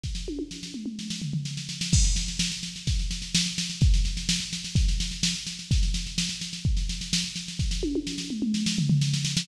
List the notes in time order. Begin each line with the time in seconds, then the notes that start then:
0.03 kick, snare
0.15 snare
0.28 high tom
0.39 high tom
0.51 snare
0.63 snare
0.74 mid tom
0.86 mid tom
0.99 snare
1.10 snare
1.22 floor tom
1.33 floor tom
1.45 snare
1.57 snare
1.69 snare
1.81 snare
1.93 kick, snare, crash
2.04 snare
2.16 snare
2.28 snare
2.39 snare
2.52 snare
2.63 snare
2.76 snare
2.87 kick, snare
2.99 snare
3.11 snare
3.22 snare
3.35 snare
3.46 snare
3.58 snare
3.70 snare
3.81 kick, snare
3.94 snare
4.05 snare
4.17 snare
4.29 snare
4.40 snare
4.53 snare
4.64 snare
4.75 kick, snare
4.88 snare
5.00 snare
5.11 snare
5.23 snare
5.35 snare
5.47 snare
5.59 snare
5.71 kick, snare
5.83 snare
5.94 snare
6.06 snare
6.18 snare
6.29 snare
6.41 snare
6.53 snare
6.65 kick
6.77 snare
6.89 snare
7.01 snare
7.13 snare
7.24 snare
7.36 snare
7.48 snare
7.59 kick, snare
7.71 snare
7.83 high tom
7.95 high tom
8.07 snare
8.18 snare
8.30 mid tom
8.42 mid tom
8.54 snare
8.66 snare
8.78 floor tom
8.89 floor tom
9.01 snare
9.13 snare
9.25 snare
9.37 snare